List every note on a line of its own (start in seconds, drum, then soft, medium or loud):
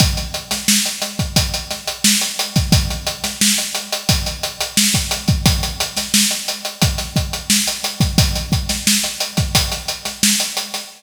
0.00 kick loud
0.00 closed hi-hat loud
0.17 closed hi-hat medium
0.34 closed hi-hat medium
0.51 snare medium
0.51 closed hi-hat medium
0.68 snare loud
0.85 closed hi-hat medium
1.02 snare soft
1.02 closed hi-hat medium
1.19 kick medium
1.19 closed hi-hat medium
1.36 kick medium
1.36 closed hi-hat loud
1.54 closed hi-hat medium
1.71 snare soft
1.71 closed hi-hat medium
1.87 closed hi-hat medium
2.04 snare loud
2.21 closed hi-hat medium
2.39 closed hi-hat medium
2.56 kick medium
2.56 snare soft
2.56 closed hi-hat medium
2.72 kick loud
2.72 closed hi-hat loud
2.90 closed hi-hat medium
3.07 closed hi-hat medium
3.24 snare medium
3.24 closed hi-hat medium
3.41 snare loud
3.58 closed hi-hat medium
3.75 closed hi-hat medium
3.92 closed hi-hat medium
4.09 kick loud
4.09 closed hi-hat loud
4.26 closed hi-hat medium
4.43 closed hi-hat medium
4.61 closed hi-hat medium
4.77 snare loud
4.94 kick medium
4.94 closed hi-hat medium
5.11 closed hi-hat medium
5.28 kick medium
5.28 closed hi-hat medium
5.46 kick loud
5.46 closed hi-hat loud
5.63 closed hi-hat medium
5.80 closed hi-hat medium
5.97 snare medium
5.97 closed hi-hat medium
6.14 snare loud
6.31 closed hi-hat medium
6.48 closed hi-hat medium
6.65 closed hi-hat medium
6.82 kick medium
6.82 closed hi-hat loud
6.98 snare soft
6.98 closed hi-hat medium
7.16 kick medium
7.16 closed hi-hat medium
7.33 closed hi-hat medium
7.50 snare loud
7.67 closed hi-hat medium
7.83 snare soft
7.83 closed hi-hat medium
8.00 kick medium
8.00 snare soft
8.00 closed hi-hat medium
8.18 kick loud
8.18 closed hi-hat loud
8.35 closed hi-hat medium
8.52 kick medium
8.52 closed hi-hat medium
8.69 snare medium
8.69 closed hi-hat medium
8.87 snare loud
9.04 closed hi-hat medium
9.20 closed hi-hat medium
9.37 kick medium
9.37 snare soft
9.37 closed hi-hat medium
9.55 kick medium
9.55 closed hi-hat loud
9.72 closed hi-hat medium
9.88 closed hi-hat medium
10.05 snare soft
10.05 closed hi-hat medium
10.23 snare loud
10.40 closed hi-hat medium
10.57 closed hi-hat medium
10.74 snare soft
10.74 closed hi-hat medium